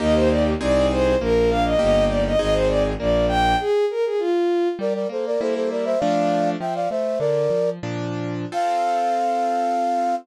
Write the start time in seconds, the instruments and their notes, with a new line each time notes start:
0.00 violin D#2 D#5, acoustic grand piano A#3 D#4 G4
0.15 violin C5
0.30 violin D5
0.60 violin C2 D5, acoustic grand piano C4 D#4 G#4
0.91 violin C5
1.20 violin A#1 A#4, acoustic grand piano A#3
1.50 acoustic grand piano D4, violin F5
1.65 violin D#5
1.79 violin G1 D#5, acoustic grand piano A#3 D#4 G4
2.09 violin D5
2.27 violin D#5
2.39 violin G#1 D#5, acoustic grand piano C4 D#4 G#4
2.54 violin C5
2.68 violin D5
2.99 violin A#1 D5, acoustic grand piano A#3
3.28 acoustic grand piano D4, violin G5
3.60 violin G#4
3.91 violin A#4
4.06 violin G#4
4.19 violin F4
4.79 acoustic grand piano G3, flute A#4 D5
4.94 flute A#4 D5
5.09 acoustic grand piano A#3, flute A4 C5
5.26 flute A#4 D5
5.41 acoustic grand piano G3 A#3 E4, flute A4 C5
5.55 flute A4 C5
5.71 flute A#4 D5
5.85 flute C5 E5
5.99 acoustic grand piano F3 A3 D4, flute D5 F5
6.60 acoustic grand piano F3, flute E5 G5
6.75 flute D5 F5
6.90 acoustic grand piano A3, flute C5 E5
7.19 acoustic grand piano D3, flute A#4 D5
7.50 acoustic grand piano F3
7.83 acoustic grand piano A#2 F3 D4
8.52 acoustic grand piano C4 F4 A4, flute F5